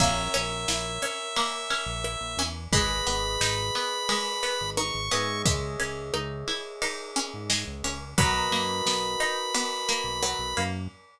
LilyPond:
<<
  \new Staff \with { instrumentName = "Lead 1 (square)" } { \time 4/4 \key b \major \tempo 4 = 88 e''1 | b''2. cis'''4 | r1 | b''1 | }
  \new Staff \with { instrumentName = "Electric Piano 1" } { \time 4/4 \key b \major <ais' cis'' e''>1 | <gis' b' dis''>2.~ <gis' b' dis''>8 <gis' cis'' dis'' e''>8~ | <gis' cis'' dis'' e''>1 | <fis' ais' b' dis''>1 | }
  \new Staff \with { instrumentName = "Pizzicato Strings" } { \time 4/4 \key b \major ais8 cis'8 e'8 cis'8 ais8 cis'8 e'8 cis'8 | gis8 b8 dis'8 b8 gis8 b8 dis'8 b8 | gis8 cis'8 dis'8 e'8 dis'8 cis'8 gis8 cis'8 | fis8 ais8 b8 dis'8 b8 ais8 fis8 ais8 | }
  \new Staff \with { instrumentName = "Synth Bass 1" } { \clef bass \time 4/4 \key b \major ais,,8 ais,,8 ais,,4.~ ais,,16 ais,,8 ais,,16 e,8 | gis,,8 gis,,8 gis,,4.~ gis,,16 gis,,8 gis,,16 gis,8 | cis,8 cis,8 cis,4.~ cis,16 gis,8 cis,16 cis,8 | b,,8 fis,8 b,,4.~ b,,16 b,,8 b,,16 fis,8 | }
  \new DrumStaff \with { instrumentName = "Drums" } \drummode { \time 4/4 <cymc bd>8 cymr8 sn8 cymr8 cymr8 cymr8 ss8 cymr8 | <bd cymr>8 cymr8 sn8 cymr8 cymr8 cymr8 ss8 cymr8 | <bd cymr>8 cymr8 ss8 cymr8 cymr8 cymr8 sn8 cymr8 | <bd cymr>8 cymr8 sn8 cymr8 cymr8 cymr8 ss8 cymr8 | }
>>